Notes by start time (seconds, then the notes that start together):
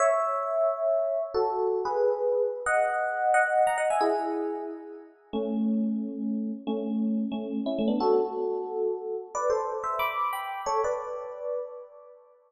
0.00 C#5 E5
1.34 F#4 A4
1.85 G#4 B4
2.66 D#5 F#5
3.34 D#5 F#5
3.67 F#5 A#5
3.78 D#5 F#5
3.90 E5 G#5
4.01 E4 G#4
5.33 A3 C#4
6.67 A3 C#4
7.32 A3 C#4
7.66 C#4 E4
7.79 A3 C#4
7.88 B3 D4
8.00 F#4 A4
9.35 B4 D5
9.50 A4 C5
9.84 C5 E5
9.99 B5 D6
10.33 G5 B5
10.66 A4 C#5
10.84 B4 D5